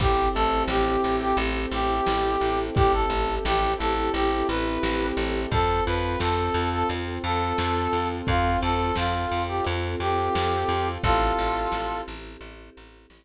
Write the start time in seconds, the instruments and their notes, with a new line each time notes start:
0.00 electric bass (finger) A1, acoustic grand piano C4, choir aahs C4 E4 G4 A4, brass section G4, kick, crash
0.34 electric bass (finger) A1, acoustic grand piano E4, brass section A4
0.68 electric bass (finger) A1, acoustic grand piano G4, brass section G4, snare
1.04 electric bass (finger) A1, acoustic grand piano A4
1.21 brass section G4
1.37 electric bass (finger) A1, acoustic grand piano G4, closed hi-hat
1.71 electric bass (finger) A1, acoustic grand piano E4, brass section G4
2.06 electric bass (finger) A1, acoustic grand piano C4, snare
2.41 electric bass (finger) A1, acoustic grand piano E4
2.75 electric bass (finger) A1, brass section G4, acoustic grand piano G4, kick, closed hi-hat
2.93 brass section A4
3.10 electric bass (finger) A1, acoustic grand piano A4
3.45 electric bass (finger) A1, brass section G4, acoustic grand piano G4, snare
3.79 electric bass (finger) A1, acoustic grand piano E4, brass section A4
4.14 electric bass (finger) A1, acoustic grand piano C4, brass section G4, closed hi-hat
4.48 electric bass (finger) A1, acoustic grand piano E4, brass section B4
4.83 electric bass (finger) A1, acoustic grand piano G4, snare
5.17 electric bass (finger) A1, acoustic grand piano A4
5.51 electric bass (finger) F2, acoustic grand piano C4, choir aahs C4 F4 A4, brass section A4, kick, closed hi-hat
5.86 electric bass (finger) F2, acoustic grand piano F4, brass section B4
6.19 electric bass (finger) F2, acoustic grand piano A4, brass section A4, snare
6.54 electric bass (finger) F2, acoustic grand piano F4
6.72 brass section A4
6.89 electric bass (finger) F2, acoustic grand piano C4, closed hi-hat
7.24 electric bass (finger) F2, acoustic grand piano F4, brass section A4
7.58 electric bass (finger) F2, acoustic grand piano A4, snare
7.93 electric bass (finger) F2, acoustic grand piano F4
8.27 electric bass (finger) F2, acoustic grand piano C4, brass section F4, kick, closed hi-hat
8.61 electric bass (finger) F2, acoustic grand piano F4, brass section A4
8.96 electric bass (finger) F2, brass section F4, acoustic grand piano A4, snare
9.29 electric bass (finger) F2, acoustic grand piano F4
9.48 brass section G4
9.65 electric bass (finger) F2, acoustic grand piano C4, closed hi-hat
10.00 electric bass (finger) F2, acoustic grand piano F4, brass section G4
10.34 electric bass (finger) F2, acoustic grand piano A4, snare
10.69 electric bass (finger) F2, acoustic grand piano F4
11.03 electric bass (finger) A1, choir aahs C4 E4 G4 A4, brass section F4 A4, kick, closed hi-hat
11.39 electric bass (finger) A1
11.72 electric bass (finger) A1, snare
12.08 electric bass (finger) A1
12.41 electric bass (finger) A1, closed hi-hat
12.77 electric bass (finger) A1
13.10 electric bass (finger) A1, snare